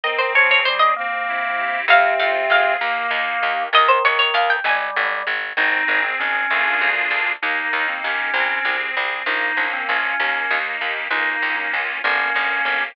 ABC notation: X:1
M:6/8
L:1/16
Q:3/8=65
K:Ab
V:1 name="Harpsichord"
e c d d c e z6 | f2 f2 f2 z6 | e c d d f g a4 z2 | z12 |
z12 | z12 | z12 |]
V:2 name="Drawbar Organ"
E,2 F,2 G,2 B,6 | C,6 B,6 | E,6 G,4 z2 | E3 C D5 z3 |
E3 C D5 z3 | E3 C D5 z3 | E3 E z2 D6 |]
V:3 name="Accordion"
C2 A2 C2 C2 =E2 G2 | C2 F2 A2 B,2 E2 G2 | z12 | C2 A2 C2 [B,=DFA]6 |
B,2 E2 G2 C2 A2 C2 | B,2 D2 F2 B,2 E2 G2 | B,2 D2 F2 B,2 D2 G2 |]
V:4 name="Electric Bass (finger)" clef=bass
z12 | F,,2 F,,2 F,,2 E,,2 E,,2 E,,2 | E,,2 E,,2 E,,2 A,,,2 A,,,2 A,,,2 | A,,,2 A,,,2 A,,,2 =D,,2 D,,2 D,,2 |
E,,2 E,,2 E,,2 C,,2 C,,2 C,,2 | B,,,2 B,,,2 B,,,2 E,,2 E,,2 E,,2 | D,,2 D,,2 D,,2 G,,,2 G,,,2 G,,,2 |]